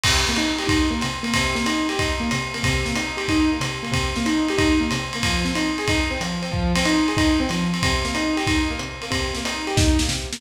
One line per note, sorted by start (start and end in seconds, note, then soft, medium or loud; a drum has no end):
0.04 0.26 C3 loud
0.04 kick medium
0.04 crash loud
0.04 ride medium
0.27 0.38 A#3 medium
0.27 snare soft
0.36 0.58 D#4 medium
0.36 hi-hat pedal medium
0.36 ride medium
0.58 0.68 G4 medium
0.58 ride medium
0.67 0.87 D#4 medium
0.67 kick medium
0.67 ride medium
0.91 0.99 A#3 medium
1.01 1.24 C3 medium
1.01 hi-hat pedal medium
1.01 ride medium
1.23 1.32 A#3 medium
1.23 ride medium
1.34 1.55 C3 loud
1.34 kick soft
1.34 ride medium
1.55 1.64 A#3 medium
1.55 snare soft
1.66 1.86 D#4 medium
1.66 hi-hat pedal medium
1.66 ride medium
1.89 1.98 G4 medium
1.89 ride medium
1.99 2.20 D#4 medium
1.99 kick soft
1.99 ride medium
2.20 2.29 A#3 medium
2.31 2.53 C3 medium
2.31 hi-hat pedal medium
2.31 ride medium
2.54 2.63 A#3 medium
2.54 ride medium
2.63 2.85 C3 loud
2.63 kick medium
2.63 ride medium
2.85 2.94 A#3 medium
2.85 snare soft
2.95 3.16 D#4 medium
2.95 hi-hat pedal medium
2.95 ride medium
3.17 3.26 G4 medium
3.17 ride medium
3.28 3.50 D#4 medium
3.28 kick soft
3.28 ride medium
3.52 3.61 A#3 medium
3.61 3.81 C3 medium
3.61 hi-hat pedal medium
3.61 ride medium
3.83 3.92 A#3 medium
3.83 ride medium
3.92 4.12 C3 loud
3.92 kick soft
3.92 ride medium
4.16 4.25 A#3 medium
4.16 snare soft
4.26 4.46 D#4 medium
4.26 hi-hat pedal medium
4.26 ride medium
4.48 4.59 G4 medium
4.48 ride medium
4.58 4.78 D#4 medium
4.58 kick medium
4.58 ride medium
4.80 4.89 A#3 medium
4.91 5.12 C3 medium
4.91 hi-hat pedal medium
4.91 ride medium
5.13 5.24 A#3 medium
5.13 ride medium
5.23 5.44 F3 loud
5.23 kick soft
5.23 ride medium
5.45 5.54 C4 medium
5.45 snare soft
5.55 5.76 D#4 medium
5.55 hi-hat pedal medium
5.55 ride medium
5.78 5.87 G#4 medium
5.78 ride medium
5.88 6.09 D#4 medium
5.88 kick medium
5.88 ride medium
6.11 6.19 C4 medium
6.21 6.41 F3 medium
6.21 hi-hat pedal medium
6.21 ride medium
6.42 6.51 C4 medium
6.42 ride medium
6.52 6.72 F3 loud
6.52 kick medium
6.75 6.85 C4 medium
6.75 snare soft
6.75 ride medium
6.85 7.06 D#4 medium
6.85 hi-hat pedal medium
6.85 ride medium
7.08 7.17 G#4 medium
7.08 ride medium
7.17 7.37 D#4 medium
7.17 kick medium
7.17 ride medium
7.40 7.49 C4 medium
7.49 7.70 F3 medium
7.49 hi-hat pedal medium
7.49 ride medium
7.73 7.82 C4 medium
7.73 ride medium
7.83 8.04 C3 loud
7.83 kick medium
7.83 ride medium
8.05 8.14 A#3 medium
8.05 snare soft
8.15 8.35 D#4 medium
8.15 hi-hat pedal medium
8.15 ride medium
8.37 8.46 G4 medium
8.37 ride medium
8.47 8.68 D#4 medium
8.47 kick medium
8.47 ride medium
8.71 8.79 A#3 medium
8.79 9.00 C3 medium
8.79 hi-hat pedal medium
9.02 9.11 A#3 medium
9.02 ride medium
9.10 9.31 C3 loud
9.10 kick soft
9.10 ride medium
9.35 9.45 A#3 medium
9.35 snare soft
9.45 9.65 D#4 medium
9.45 hi-hat pedal medium
9.45 ride medium
9.67 9.76 G4 medium
9.67 ride medium
9.77 9.97 D#4 medium
9.77 kick medium
9.77 snare medium
9.99 10.11 A#3 medium
9.99 snare medium
10.09 10.29 C3 medium
10.09 snare medium
10.33 10.41 A#3 medium
10.33 snare medium